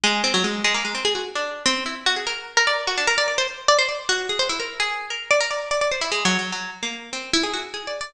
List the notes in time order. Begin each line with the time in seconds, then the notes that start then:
0.04 G#3
0.24 C4
0.34 F#3
0.44 G#3
0.64 G#3
0.74 A#3
0.85 G#3
0.95 C4
1.05 G#4
1.15 F#4
1.35 D4
1.66 C4
1.86 E4
2.06 F#4
2.16 G#4
2.27 A#4
2.57 A#4
2.67 D5
2.87 F#4
2.97 D4
3.07 A#4
3.18 D5
3.28 D5
3.38 C5
3.68 D5
3.79 C5
3.89 D5
4.09 F#4
4.29 G#4
4.39 C5
4.49 E4
4.60 A#4
4.80 G#4
5.10 A#4
5.31 D5
5.40 A#4
5.51 D5
5.71 D5
5.81 D5
5.91 C5
6.01 E4
6.12 G#3
6.25 F#3
6.39 F#3
6.52 F#3
6.83 A#3
7.13 C4
7.33 E4
7.43 G#4
7.53 F#4
7.74 G#4
7.87 D5
8.01 D5